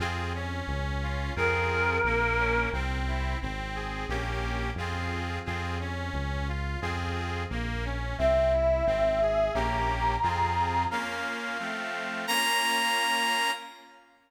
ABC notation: X:1
M:2/4
L:1/8
Q:1/4=88
K:Fm
V:1 name="Choir Aahs"
z4 | B4 | z4 | z4 |
z4 | z4 | =e4 | b4 |
[K:Bbm] z4 | z4 |]
V:2 name="Brass Section"
z4 | z4 | z4 | z4 |
z4 | z4 | z4 | z4 |
[K:Bbm] f4 | b4 |]
V:3 name="Accordion"
[CFA] D2 F | [CFA]2 B, D | C =E C A | [B,DG]2 [CFA]2 |
[CFA] D2 F | [CFA]2 B, D | C =E C A | [B,DG]2 [CFA]2 |
[K:Bbm] [B,DF]2 [F,=A,C]2 | [B,DF]4 |]
V:4 name="Synth Bass 1" clef=bass
F,,2 D,,2 | F,,2 B,,,2 | C,,2 A,,,2 | B,,,2 F,,2 |
F,,2 D,,2 | F,,2 B,,,2 | C,,2 A,,,2 | B,,,2 F,,2 |
[K:Bbm] z4 | z4 |]